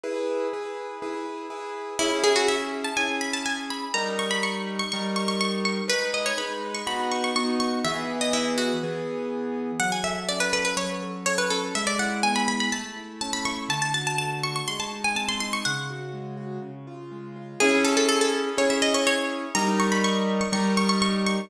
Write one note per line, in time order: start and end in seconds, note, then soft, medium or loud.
0.03 0.47 E4 loud
0.03 0.47 G#4 loud
0.03 0.47 B4 medium
0.53 0.97 E4 medium
0.53 0.97 G#4 medium
0.53 0.97 B4 medium
1.02 1.46 E4 medium
1.02 1.46 G#4 medium
1.02 1.46 B4 medium
1.50 1.94 E4 medium
1.50 1.94 G#4 medium
1.50 1.94 B4 medium
1.99 2.88 C#4 loud
1.99 2.19 E4 loud
1.99 2.88 E4 loud
1.99 2.88 G#4 loud
2.24 2.35 G#4 loud
2.36 2.47 F#4 medium
2.48 2.82 E5 loud
2.84 2.96 A5 medium
2.97 3.85 C#4 medium
2.97 3.85 E4 medium
2.97 3.85 G#4 medium
2.97 3.17 G#5 loud
3.21 3.33 B5 medium
3.33 3.45 A5 medium
3.46 3.57 G#5 medium
3.70 3.93 B5 medium
3.94 4.82 G3 loud
3.94 4.82 D#4 loud
3.94 4.82 A#4 loud
3.94 4.14 A#5 loud
4.19 4.30 C#6 medium
4.31 4.42 B5 loud
4.43 4.75 C#6 medium
4.79 4.91 C#6 loud
4.92 5.81 G3 loud
4.92 5.81 D#4 medium
4.92 5.81 A#4 loud
4.92 5.15 C#6 medium
5.16 5.28 C#6 medium
5.28 5.40 C#6 loud
5.41 5.52 C#6 loud
5.65 5.86 C#6 medium
5.88 6.32 G#3 medium
5.88 6.32 D#4 medium
5.88 6.32 B4 loud
5.88 6.09 B4 loud
6.14 6.26 D#5 medium
6.26 6.37 C#5 medium
6.37 6.81 G#3 medium
6.37 6.81 D#4 medium
6.37 6.81 B4 loud
6.37 6.71 B5 medium
6.74 6.86 C#6 medium
6.87 7.30 B3 loud
6.87 7.30 D#4 medium
6.87 7.30 F#4 loud
6.87 7.07 B5 loud
7.11 7.23 C#6 medium
7.24 7.35 C#6 medium
7.36 7.80 B3 medium
7.36 7.80 D#4 medium
7.36 7.80 F#4 medium
7.36 7.47 C#6 loud
7.60 7.83 C#6 medium
7.85 8.72 E3 loud
7.85 8.72 B3 loud
7.85 8.72 G#4 loud
7.85 8.05 E5 loud
8.21 8.33 D#5 medium
8.33 8.56 E4 loud
8.58 8.99 F#4 medium
8.83 9.71 E3 medium
8.83 9.71 B3 loud
8.83 9.71 G#4 medium
9.80 10.76 F#3 medium
9.80 9.91 F#5 loud
9.92 10.04 G#5 medium
10.03 10.52 A4 medium
10.03 10.25 E5 loud
10.29 11.50 C#4 medium
10.29 10.40 D5 loud
10.40 10.52 B4 loud
10.53 11.02 A4 medium
10.53 10.64 B4 loud
10.65 10.76 B4 medium
10.77 11.69 F#3 medium
10.77 11.20 C#5 medium
11.02 11.26 A4 medium
11.26 11.73 A4 medium
11.26 11.38 C#5 loud
11.38 11.50 B4 medium
11.50 11.73 C#4 medium
11.50 11.73 A4 medium
11.75 12.68 G#3 medium
11.75 11.87 E5 loud
11.87 11.98 D5 loud
11.99 12.47 E4 medium
11.99 12.23 F#5 loud
12.23 12.70 B3 medium
12.23 12.35 G#5 loud
12.36 12.47 B5 loud
12.48 12.71 E4 medium
12.48 12.60 B5 loud
12.60 12.72 B5 loud
12.72 13.65 A3 medium
12.72 13.18 A5 medium
12.97 13.45 E4 medium
13.21 13.68 C#4 medium
13.21 13.33 A5 loud
13.33 13.45 B5 loud
13.45 13.69 E4 medium
13.45 13.68 C#6 loud
13.69 14.61 D3 medium
13.69 13.81 A5 loud
13.82 13.93 A5 loud
13.94 14.44 F#4 medium
13.94 14.06 A5 medium
14.07 14.18 A5 loud
14.18 14.66 A3 medium
14.18 14.39 A5 medium
14.43 14.68 F#4 medium
14.43 14.55 C#6 loud
14.56 14.67 C#6 medium
14.68 15.61 G#3 medium
14.68 14.79 C6 medium
14.80 14.91 A5 medium
14.92 15.40 D#4 medium
15.04 15.16 G#5 loud
15.15 15.61 C4 medium
15.15 15.28 A5 medium
15.29 15.40 C6 loud
15.40 15.63 D#4 medium
15.40 15.52 C6 loud
15.53 15.65 C#6 loud
15.65 16.59 C#3 medium
15.65 17.05 F#5 loud
15.90 16.36 F#4 medium
16.13 16.60 G#3 medium
16.37 16.60 F#4 medium
16.62 17.55 C#3 medium
16.87 17.36 F4 medium
17.11 17.58 G#3 medium
17.36 17.59 F4 medium
17.60 18.49 C#4 loud
17.60 18.49 E4 loud
17.60 17.80 G#4 loud
17.60 18.49 G#4 loud
17.84 17.96 A4 loud
17.97 18.08 A4 loud
18.09 18.20 A4 loud
18.21 18.33 A4 loud
18.57 19.45 C#4 loud
18.57 19.45 E4 loud
18.57 19.45 G#4 loud
18.57 18.70 C#5 medium
18.70 18.82 E5 medium
18.82 18.94 D#5 medium
18.94 19.06 C#5 loud
19.07 19.53 C#5 loud
19.55 20.43 G3 loud
19.55 20.43 D#4 loud
19.55 20.43 A#4 loud
19.55 19.76 A#5 loud
19.80 19.91 C#6 loud
19.92 20.03 B5 loud
20.04 20.37 C#6 loud
20.41 20.52 C#6 loud
20.52 21.40 G3 loud
20.52 21.40 D#4 loud
20.52 21.40 A#4 loud
20.52 20.72 C#6 loud
20.77 20.89 C#6 loud
20.89 21.01 C#6 loud
21.02 21.13 C#6 loud
21.26 21.50 C#6 loud